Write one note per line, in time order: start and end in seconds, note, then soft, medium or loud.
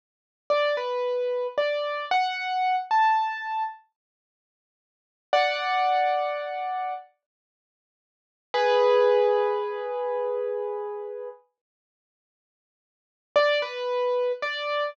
0.50 0.75 D5 medium
0.77 1.47 B4 medium
1.58 2.05 D5 medium
2.11 2.76 F#5 medium
2.91 3.63 A5 medium
5.33 6.94 D5 medium
5.33 6.94 F#5 medium
8.54 11.29 G#4 medium
8.54 11.29 B4 loud
13.36 13.61 D5 loud
13.62 14.32 B4 medium
14.42 14.90 D5 medium